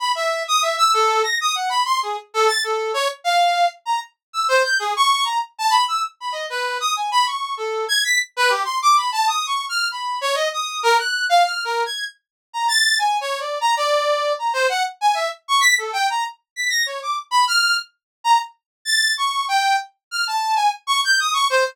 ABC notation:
X:1
M:7/8
L:1/16
Q:1/4=97
K:none
V:1 name="Brass Section"
b e2 _e' =e =e' A2 _b' _e' _g =b c' _A | z A a' A2 _d z f3 z _b z2 | e' c g' _A _d'2 _b z =a =b e' z b _e | B2 _e' _a b _d'2 =A2 _a' b' z B G |
c' d' b a (3_e'2 _d'2 f'2 b2 _d _e e'2 | _B _g'2 f (3f'2 B2 _a'2 z3 _b =a'2 | (3_a2 _d2 =d2 _b d4 b c _g z a | e z _d' b' A g _b z2 =b' _b' _d =d' z |
b f'2 z3 _b z3 a'2 _d'2 | g2 z2 f' a2 _a z _d' g' _e' d' c |]